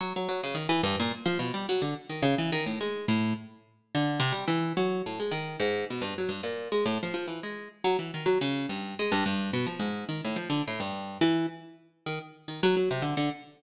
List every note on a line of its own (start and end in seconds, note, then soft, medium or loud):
0.01 0.13 F#3 medium
0.16 0.28 F#3 medium
0.29 0.41 F#3 medium
0.43 0.56 C#3 medium
0.55 0.67 D#3 medium
0.69 0.82 E3 loud
0.83 0.96 G2 loud
1.00 1.12 A#2 loud
1.26 1.38 F3 loud
1.39 1.52 B2 medium
1.54 1.67 G3 medium
1.69 1.82 F#3 medium
1.82 1.94 D3 medium
2.09 2.22 D#3 medium
2.23 2.35 C#3 loud
2.38 2.51 E3 medium
2.52 2.65 D#3 medium
2.66 2.79 A2 medium
2.81 3.06 G#3 medium
3.08 3.34 A2 medium
3.95 4.20 D3 loud
4.20 4.32 C3 loud
4.32 4.45 G3 medium
4.48 4.73 E3 loud
4.77 5.02 F#3 loud
5.06 5.19 A2 soft
5.20 5.32 G#3 medium
5.31 5.57 D#3 medium
5.60 5.85 G#2 medium
5.90 6.03 B2 medium
6.02 6.14 G2 medium
6.18 6.31 F#3 medium
6.29 6.41 G2 medium
6.43 6.68 A#2 medium
6.72 6.84 G#3 medium
6.86 6.98 A2 medium
7.03 7.13 F3 medium
7.14 7.26 F3 medium
7.28 7.40 E3 medium
7.43 7.68 G#3 medium
7.84 7.97 F#3 loud
7.99 8.11 E3 medium
8.14 8.27 D#3 medium
8.26 8.38 F#3 medium
8.41 8.66 C#3 medium
8.69 8.95 G2 medium
8.99 9.12 G#3 medium
9.12 9.24 G2 loud
9.26 9.51 G2 medium
9.53 9.66 B2 medium
9.66 9.79 F3 medium
9.79 10.05 G#2 medium
10.09 10.21 D#3 medium
10.25 10.37 A2 medium
10.36 10.49 F3 medium
10.50 10.62 D3 medium
10.68 10.80 A2 medium
10.80 11.18 G2 medium
11.21 11.46 E3 loud
12.06 12.19 D#3 medium
12.48 12.61 D#3 soft
12.63 12.76 F#3 loud
12.77 12.89 F#3 medium
12.91 13.03 C3 medium
13.02 13.15 D3 medium
13.17 13.30 D3 medium